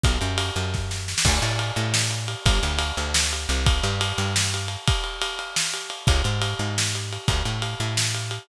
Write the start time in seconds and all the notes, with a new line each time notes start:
0.04 B1, kick, ride
0.21 F#2, ride
0.38 ride
0.56 F#2, ride
0.74 kick, snare
0.91 snare
1.08 snare
1.18 snare
1.25 D2, kick, crash
1.42 A2, ride
1.59 ride
1.76 A2, ride
1.94 snare
2.11 ride
2.28 ride
2.46 G1, kick, ride
2.63 D2, ride
2.79 ride
2.97 D2, ride
3.14 snare
3.33 ride
3.49 C2, ride
3.66 kick, ride
3.83 G2, ride
4.01 ride
4.18 G2, ride
4.36 snare
4.54 ride
4.68 ride
4.88 kick, ride
5.04 ride
5.22 ride
5.39 ride
5.56 snare
5.74 ride
5.90 ride
6.07 C#2, kick, ride
6.24 G#2, ride
6.42 ride
6.59 G#2, ride
6.78 snare
6.95 ride
7.13 ride
7.28 D2, kick, ride
7.45 A2, ride
7.62 ride
7.80 A2, ride
7.97 snare
8.15 ride
8.31 ride